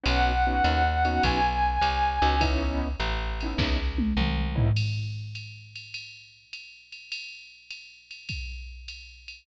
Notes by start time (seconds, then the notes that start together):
0.04 B1 B3 C#4 D#4 F#4, ride
0.08 F#5
0.47 B3 C#4 D#4 F#4
0.64 D#2, hi-hat pedal, ride
1.05 B3 C#4 D#4 F#4, ride
1.23 B1 G#5, kick, ride
1.81 C2, hi-hat pedal, ride
2.22 C#2 B3 C#4 D#4 F#4, ride
2.41 B3 C#4 D#4 E4, kick, ride
3.00 A1, hi-hat pedal, ride
3.41 B3 C#4 D#4 E4, ride
3.58 C#2, kick, snare
3.98 high tom
4.17 C2, mid tom
4.55 B3 C#4 D#4 E4, floor tom
4.76 crash, ride
5.35 hi-hat pedal, ride
5.75 ride
5.94 ride
6.53 hi-hat pedal, ride
6.92 ride
7.12 ride
7.70 hi-hat pedal, ride
8.11 ride
8.29 kick, ride
8.88 hi-hat pedal, ride
9.28 ride